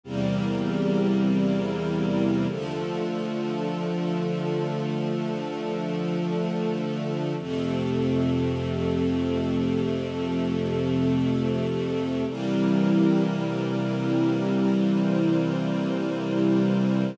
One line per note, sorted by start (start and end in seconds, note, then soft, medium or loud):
0.03 2.46 E2 loud
0.03 2.46 C3 loud
0.03 1.25 E3 medium
0.03 2.46 G3 loud
0.03 2.46 A#3 medium
0.03 1.25 C4 medium
0.03 1.25 G4 medium
0.03 1.25 A#4 medium
1.26 2.47 E3 medium
1.26 2.47 C4 medium
1.26 2.47 E4 medium
1.26 2.47 A#4 medium
2.49 7.34 D3 medium
2.49 7.34 F3 loud
2.49 7.34 A3 loud
2.49 4.91 D4 medium
2.49 4.91 F4 medium
2.49 4.91 A4 medium
4.93 7.36 A3 medium
4.93 7.36 D4 medium
4.93 7.36 A4 medium
7.38 12.23 F2 loud
7.38 12.23 C3 loud
7.38 9.81 F3 medium
7.38 12.23 A3 loud
7.38 9.81 C4 medium
7.38 9.81 A4 medium
9.83 12.26 F3 medium
9.83 12.26 A3 medium
9.83 12.26 A4 medium
12.27 17.12 C3 loud
12.27 17.12 E3 loud
12.27 17.12 G3 loud
12.27 17.12 A#3 medium
12.27 14.71 C4 medium
12.27 14.71 E4 medium
12.27 14.71 G4 medium
12.27 14.71 A#4 medium
14.73 17.15 C4 medium
14.73 17.15 E4 medium
14.73 17.15 A#4 medium
14.73 17.15 C5 medium